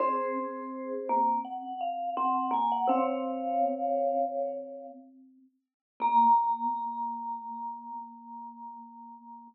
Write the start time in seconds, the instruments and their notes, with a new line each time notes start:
0.00 vibraphone C4 G#4 C5, marimba C4
1.09 vibraphone A#3
1.44 vibraphone F#5
1.81 vibraphone F5
2.17 vibraphone C4 F#5
2.51 vibraphone A#3 G#5
2.72 vibraphone F#5
2.87 vibraphone C3 C#5 F5, marimba C4
6.00 marimba A#3, vibraphone A#3 A#5